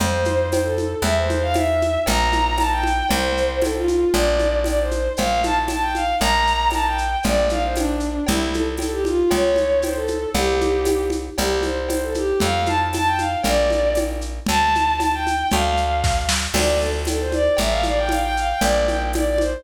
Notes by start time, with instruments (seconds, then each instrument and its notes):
0.00 electric bass (finger) F2, violin C5, cowbell, low conga, shaker
0.25 high conga, shaker
0.51 violin C5, tambourine, cowbell, high conga, shaker
0.64 violin A4
0.78 high conga, shaker
1.02 electric bass (finger) E2, violin E5, cowbell, low conga, shaker
1.17 violin C5
1.30 high conga, shaker
1.42 violin F5
1.54 violin E5, tambourine, cowbell, high conga, shaker
1.82 high conga, shaker
2.06 electric bass (finger) A#1, violin A#5, cowbell, low conga, shaker
2.32 high conga, shaker
2.58 violin A5, tambourine, cowbell, high conga, shaker
2.71 violin G5
2.83 high conga, shaker
3.09 electric bass (finger) C2, violin C5, cowbell, low conga, shaker
3.37 shaker
3.62 violin A4, tambourine, cowbell, high conga, shaker
3.75 violin F4
3.88 high conga, shaker
4.13 electric bass (finger) A#1, violin D5, cowbell, low conga, shaker
4.39 high conga, shaker
4.64 violin D5, tambourine, cowbell, high conga, shaker
4.80 violin C5
4.91 high conga, shaker
5.17 electric bass (finger) A#1, violin F5, cowbell, low conga, shaker
5.43 violin A5, high conga, shaker
5.68 violin A5, tambourine, cowbell, high conga, shaker
5.81 violin G5
5.95 violin F5, high conga, shaker
6.20 electric bass (finger) A#1, violin A#5, cowbell, low conga, shaker
6.47 shaker
6.70 violin A5, tambourine, cowbell, high conga, shaker
6.85 violin G5
6.98 shaker
7.23 electric bass (finger) A#1, violin D5, cowbell, low conga, shaker
7.49 violin F5, high conga, shaker
7.63 violin C5
7.76 violin D4, tambourine, cowbell, high conga, shaker
8.00 shaker
8.27 electric bass (finger) C2, violin E4, cowbell, low conga, shaker
8.54 violin A4, high conga, shaker
8.77 violin A4, tambourine, cowbell, high conga, shaker
8.92 violin G4
9.05 violin F4, high conga, shaker
9.30 electric bass (finger) C#2, violin C#5, cowbell, low conga, shaker
9.56 high conga, shaker
9.82 violin C5, tambourine, cowbell, high conga, shaker
9.95 violin A4
10.08 high conga, shaker
10.34 electric bass (finger) C2, violin G4, cowbell, low conga, shaker
10.61 high conga, shaker
10.85 tambourine, cowbell, high conga, shaker
11.10 high conga, shaker
11.38 electric bass (finger) C2, violin G4, cowbell, low conga, shaker
11.63 violin C5, high conga, shaker
11.88 violin C5, tambourine, cowbell, high conga, shaker
12.03 violin A4
12.14 violin G4, high conga, shaker
12.40 electric bass (finger) F2, violin F5, cowbell, low conga, shaker
12.66 violin A5, high conga, shaker
12.93 violin A5, tambourine, cowbell, high conga, shaker
13.06 violin G5
13.18 violin F5, high conga, shaker
13.43 electric bass (finger) A#1, violin D5, cowbell, low conga, shaker
13.70 high conga, shaker
13.95 tambourine, cowbell, high conga, shaker
14.21 shaker
14.46 electric bass (finger) D2, violin A5, cowbell, low conga, shaker
14.75 high conga, shaker
14.99 violin A5, tambourine, cowbell, high conga, shaker
15.13 violin G5
15.27 high conga, shaker
15.50 electric bass (finger) D2, violin F5, cowbell, low conga, shaker
15.65 violin F5
15.77 shaker
16.04 kick, snare
16.29 snare
16.54 electric bass (finger) D2, violin D5, crash, cowbell, low conga, shaker
16.80 violin A4, shaker
17.05 violin A4, tambourine, cowbell, high conga, shaker
17.20 violin C5
17.32 violin D5, high conga, shaker
17.57 electric bass (finger) A1, violin E5, cowbell, low conga, shaker
17.71 violin F5
17.83 violin D5, high conga, shaker
17.98 violin G5
18.09 violin F5, tambourine, cowbell, high conga, shaker
18.23 violin G5
18.37 violin F5, shaker
18.50 violin G5
18.61 electric bass (finger) A#1, violin D5, cowbell, low conga, shaker
18.87 violin G5, high conga, shaker
19.13 violin D5, tambourine, cowbell, high conga, shaker
19.26 violin D5
19.38 violin C5, high conga, shaker